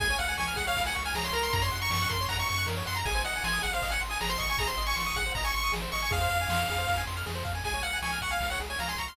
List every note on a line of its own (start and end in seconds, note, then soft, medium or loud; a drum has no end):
0.00 0.16 C#2 medium
0.00 0.08 G#4 loud
0.00 0.17 G#5 medium
0.00 kick loud
0.00 ride loud
0.10 0.19 C#5 medium
0.18 0.36 C#2 medium
0.18 0.27 F5 medium
0.18 0.34 F#5 medium
0.18 ride medium
0.28 0.37 G#5 loud
0.38 0.55 C#2 medium
0.38 0.55 G#5 medium
0.38 0.46 C#6 loud
0.38 snare loud
0.48 0.56 F6 medium
0.56 0.74 C#2 medium
0.56 0.65 G#4 medium
0.56 0.66 F#5 medium
0.56 kick loud
0.56 ride medium
0.67 0.76 C#5 medium
0.67 0.83 F5 medium
0.75 0.91 C#2 medium
0.75 0.85 F5 medium
0.75 kick loud
0.75 ride loud
0.86 0.96 F#5 medium
0.86 0.94 G#5 loud
0.95 1.13 C#2 medium
0.95 1.03 C#6 medium
0.95 ride medium
1.05 1.14 G#5 medium
1.05 1.14 F6 medium
1.14 1.30 C#2 medium
1.14 1.24 G#4 medium
1.14 1.25 A#5 medium
1.14 snare loud
1.24 1.33 C#5 medium
1.24 1.34 C6 medium
1.33 1.50 C#2 medium
1.33 1.61 A#4 loud
1.33 1.43 A#5 medium
1.33 ride medium
1.43 1.52 C6 medium
1.53 1.70 F#2 medium
1.53 1.62 A#5 medium
1.53 kick loud
1.53 ride loud
1.62 1.70 C#5 medium
1.62 1.79 C6 medium
1.72 1.90 F#2 medium
1.72 1.80 F#5 medium
1.72 ride medium
1.82 1.91 A#5 medium
1.82 1.91 C#6 medium
1.90 2.06 F#2 medium
1.90 2.09 C#6 medium
1.90 2.01 C#6 medium
1.90 snare loud
2.02 2.11 F#6 medium
2.09 2.27 F#2 medium
2.09 2.18 A#4 medium
2.09 2.25 C6 medium
2.09 kick loud
2.09 ride medium
2.21 2.29 C#5 medium
2.29 2.45 F#2 medium
2.29 2.37 F#5 loud
2.29 2.38 A#5 medium
2.29 kick loud
2.29 ride loud
2.39 2.48 A#5 medium
2.39 2.48 C#6 medium
2.48 2.66 F#2 medium
2.48 2.67 C#6 medium
2.48 2.58 C#6 medium
2.48 ride medium
2.58 2.66 F#6 medium
2.66 2.83 F#2 medium
2.66 2.75 A#4 medium
2.66 snare loud
2.77 2.85 C#5 medium
2.86 3.04 F#2 medium
2.86 2.94 F#5 medium
2.86 2.96 C6 medium
2.86 ride medium
2.95 3.04 A#5 medium
2.95 3.05 A#5 medium
3.05 3.22 G#1 medium
3.05 3.14 G#4 medium
3.05 3.22 G#5 medium
3.05 kick loud
3.05 ride loud
3.15 3.23 C5 medium
3.24 3.40 G#1 medium
3.24 3.34 D#5 medium
3.24 3.43 F#5 medium
3.24 ride medium
3.36 3.44 G#5 medium
3.44 3.60 G#1 medium
3.44 3.63 G#5 medium
3.44 3.53 C6 medium
3.44 snare loud
3.53 3.62 D#6 medium
3.62 3.80 G#1 medium
3.62 3.71 G#4 medium
3.62 3.72 F#5 medium
3.62 kick medium
3.62 ride medium
3.73 3.83 C5 medium
3.73 3.91 F5 medium
3.82 3.98 G#1 medium
3.82 3.91 D#5 medium
3.82 kick loud
3.82 ride loud
3.90 4.01 F#5 medium
3.90 3.99 G#5 medium
4.01 4.17 G#1 medium
4.01 4.09 C6 medium
4.01 ride medium
4.10 4.20 G#5 medium
4.10 4.18 D#6 medium
4.21 4.37 G#1 medium
4.21 4.30 G#4 medium
4.21 4.30 A#5 medium
4.21 snare loud
4.29 4.38 C5 medium
4.29 4.39 C6 medium
4.38 4.56 G#1 medium
4.38 4.47 D#5 medium
4.38 4.49 C#6 medium
4.38 kick medium
4.38 ride medium
4.49 4.58 G#5 medium
4.49 4.59 C#6 medium
4.57 4.74 G#1 medium
4.57 4.68 G#4 loud
4.57 4.68 A#5 medium
4.57 kick loud
4.57 ride loud
4.68 4.76 C5 medium
4.68 4.83 C6 medium
4.78 4.94 G#1 medium
4.78 4.86 D#5 medium
4.78 ride medium
4.86 4.95 G#5 medium
4.86 4.96 C#6 medium
4.96 5.12 G#1 medium
4.96 5.04 C6 medium
4.96 5.16 C#6 medium
4.96 snare loud
5.06 5.15 D#6 medium
5.14 5.31 G#1 medium
5.14 5.25 G#4 medium
5.14 5.32 F#5 medium
5.14 kick loud
5.14 ride medium
5.26 5.35 C5 medium
5.35 5.51 G#1 medium
5.35 5.45 D#5 medium
5.35 5.44 A#5 medium
5.35 kick loud
5.35 ride loud
5.44 5.52 G#5 medium
5.44 5.54 C#6 medium
5.54 5.71 G#1 medium
5.54 5.62 C6 medium
5.54 5.72 C#6 medium
5.54 ride medium
5.64 5.72 D#6 medium
5.72 5.88 G#1 medium
5.72 5.81 G#4 medium
5.72 snare loud
5.82 5.91 C5 medium
5.92 6.10 G#1 medium
5.92 6.02 D#5 medium
5.92 6.01 C#6 medium
5.92 ride medium
6.02 6.11 G#5 medium
6.02 6.11 C#6 medium
6.11 6.27 F2 medium
6.11 6.19 G#4 loud
6.11 7.02 F5 medium
6.11 kick loud
6.11 ride loud
6.21 6.30 C5 medium
6.29 6.46 F2 medium
6.29 6.38 F5 medium
6.29 ride medium
6.41 6.50 G#5 medium
6.48 6.65 F2 medium
6.48 6.59 C6 medium
6.48 snare loud
6.59 6.68 F6 medium
6.69 6.86 F2 medium
6.69 6.78 G#4 medium
6.69 kick medium
6.69 ride medium
6.78 6.87 C5 medium
6.87 7.04 F2 medium
6.87 6.96 F5 medium
6.87 kick loud
6.87 ride loud
6.97 7.06 G#5 medium
7.07 7.24 F2 medium
7.07 7.16 C6 medium
7.07 ride medium
7.17 7.25 F6 medium
7.26 7.43 F2 medium
7.26 7.34 G#4 medium
7.26 snare loud
7.35 7.44 C5 medium
7.45 7.62 F2 medium
7.45 7.53 F5 medium
7.45 kick loud
7.45 ride medium
7.55 7.63 G#5 medium
7.64 7.81 C#2 medium
7.64 7.74 G#4 medium
7.64 7.83 G#5 medium
7.64 kick loud
7.64 ride loud
7.74 7.83 C#5 medium
7.83 7.99 C#2 medium
7.83 7.92 F5 medium
7.83 7.98 F#5 medium
7.83 ride medium
7.93 8.02 G#5 medium
8.02 8.19 C#2 medium
8.02 8.19 G#5 medium
8.02 8.11 C#6 medium
8.02 snare loud
8.13 8.21 F6 medium
8.21 8.37 C#2 medium
8.21 8.31 F#5 medium
8.21 8.31 C#6 medium
8.21 kick loud
8.21 ride medium
8.31 8.47 F5 medium
8.31 8.39 G#5 medium
8.41 8.57 C#2 medium
8.41 8.49 F5 medium
8.41 kick medium
8.41 ride loud
8.50 8.60 C#5 medium
8.50 8.59 F#5 medium
8.60 8.76 C#2 medium
8.60 8.69 G#4 medium
8.60 ride medium
8.70 8.78 C#5 medium
8.70 8.79 G#5 medium
8.79 8.95 C#2 medium
8.79 8.87 F5 medium
8.79 8.89 A#5 medium
8.79 snare loud
8.88 8.96 G#5 medium
8.88 8.98 C6 medium
8.96 9.12 C#2 medium
8.96 9.07 A#5 medium
8.96 9.08 C#6 medium
8.96 kick medium
8.96 ride medium
9.08 9.16 C6 medium
9.08 9.16 F6 medium